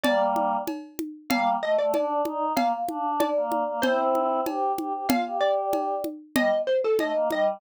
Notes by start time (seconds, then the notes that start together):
0.04 G3 A#3 D5, cowbell, low conga
0.36 high conga
0.67 cowbell, high conga
0.99 high conga
1.30 G3 A#3 F5, cowbell, low conga
1.62 A3 D#5
1.78 A3 D5
1.94 D4 D5, cowbell, high conga
2.25 D#4, high conga
2.57 A#3 F5, cowbell, low conga
2.89 D4, high conga
3.20 D5, cowbell, high conga
3.36 A#3
3.52 high conga
3.67 A#3
3.82 C4 E4 C5, cowbell, low conga
4.15 high conga
4.46 G4, cowbell, high conga
4.78 G4, high conga
4.93 G4
5.09 F4 F5, cowbell, low conga
5.26 G4
5.41 D5
5.73 cowbell, high conga
6.04 high conga
6.36 G3 D#5, cowbell, low conga
6.67 C5
6.84 A4
6.99 A3 D#5, cowbell, high conga
7.15 A#3
7.31 G3 D#5, high conga